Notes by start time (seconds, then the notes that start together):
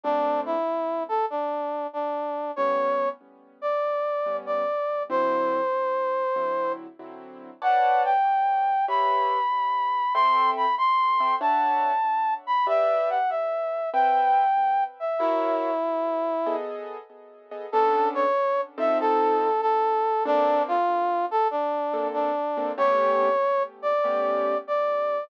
0.04 A#2 A3 C4 D4
0.46 E4
1.09 A4
1.30 D4
1.93 D4
2.56 A2 G3 B3 C#4 C#5
3.62 D5
4.26 A2 G3 B3 C#4
4.46 D5
5.10 D3 F#3 C4 E4 C5
6.36 D3 F#3 C4 E4
6.99 D3 F#3 C4 E4
7.62 B4 C#5 D5 F#5 A5
8.05 G5
8.88 G4 B4 C#5 E5 B5
10.14 C4 A4 E5 G5 C6
10.57 B5
10.78 C6
11.20 C4 A4 E5 G5
11.41 D4 C#5 E5 F#5 A5
12.47 B5
12.67 G4 B4 D5 E5
13.10 F#5
13.30 E5
13.94 C4 B4 E5 G5
15.00 E5
15.19 E4 F#4 A#4 C#5 E5
16.46 B3 G#4 A4 D#5
17.51 B3 G#4 A4 D#5
17.72 B3 C#4 D4 A4
18.15 C#5
18.78 F3 C4 D#4 A4 E5
19.00 A4
19.61 A4
20.25 A#3 C4 D4 A4
20.68 F4
21.31 A4
21.51 D4
21.94 A#3 C4 D4 A4
22.14 D4
22.57 A#3 C4 D4 A4
22.78 A3 B3 C#4 G4 C#5
23.82 D5
24.04 A3 B3 C#4 G4
24.68 D5